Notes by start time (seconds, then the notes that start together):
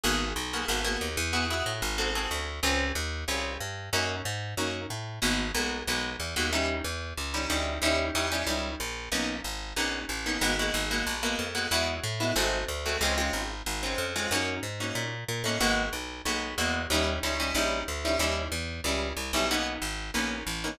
0.04 G#1 A#3 B3 F#4 G#4
0.36 B1
0.53 A#3 B3 F#4 G#4
0.68 G#1 A#3 B3 F#4 G#4
0.84 A#3 B3 F#4 G#4
1.01 D#2
1.17 E2
1.33 B3 E4 F#4 G#4
1.50 B3 E4 F#4 G#4
1.66 A2
1.82 G#1
1.98 C4 F#4 G#4 A4
2.15 C4 F#4 G#4 A4
2.31 D2
2.63 C#2 C4 C#4 F4 G#4
2.95 D#2
3.28 C2 C4 C#4 F4 G#4
3.60 G2
3.93 F#2 A#3 C#4 D#4 F#4
4.25 G#2
4.57 F#2 A#3 C#4 D#4 F#4
4.90 A2
5.22 G#1 G#3 A#3 B3 F#4
5.54 B1 G#3 A#3 B3 F#4
5.87 B1 G#3 A#3 B3 F#4
6.20 E2
6.36 D#2 G#3 A#3 B3 F#4
6.53 G3 C#4 D#4 E4
6.84 E2
7.17 C#2
7.34 G3 C#4 D#4 E4
7.50 D2 G3 C#4 D#4 E4
7.82 D#2 G3 C#4 D#4 E4
8.15 E2 G3 C#4 D#4 E4
8.32 G3 C#4 D#4 E4
8.47 C#2 G3 C#4 D#4 E4
8.80 A#1
9.12 B1 A#3 B3 C#4 D#4
9.44 G#1
9.76 A#1 A#3 B3 C#4 D#4
10.09 A1
10.26 A#3 B3 C#4 D#4
10.41 G#1 G#3 A#3 B3 F#4
10.59 G#3 A#3 B3 F#4
10.74 G#1
10.91 G#3 A#3 B3 F#4
11.07 A#1
11.23 G#3 A#3 B3 F#4
11.39 F2
11.55 G#3 A#3 B3 F#4
11.71 E2 G#3 B3 E4 F#4
12.04 A2
12.20 G#3 B3 E4 F#4
12.36 G#1 G#3 A3 C4 F#4
12.68 D2
12.85 G#3 A3 C4 F#4
13.01 C#2 G#3 C4 C#4 F4
13.18 G#3 C4 C#4 F4
13.33 G#1
13.66 G#1
13.83 G#3 C4 C#4 F4
13.98 F2
14.16 G#3 C4 C#4 F4
14.31 F#2 A#3 C#4 D#4 F#4
14.63 G#2
14.80 A#3 C#4 D#4 F#4
14.95 A#2
15.28 A#2
15.44 A2 A#3 C#4 D#4 F#4
15.60 G#1 G#3 A#3 B3 F#4
15.93 B1
16.25 B1 G#3 A#3 B3 F#4
16.58 E2 G#3 A#3 B3 F#4
16.90 D#2 G3 C#4 D#4 E4
17.23 C#2 G3 C#4 D#4 E4
17.40 G3 C#4 D#4 E4
17.55 A#1 G3 C#4 D#4 E4
17.88 D2
18.05 G3 C#4 D#4 E4
18.19 D#2 G3 C#4 D#4 E4
18.52 E2
18.84 C#2 G3 C#4 D#4 E4
19.17 C2
19.33 B1 G3 C#4 D#4 E4
19.51 A#3 B3 C#4 D#4
19.82 G#1
20.14 A#1 A#3 B3 C#4 D#4
20.47 A1
20.64 A#3 B3 C#4 D#4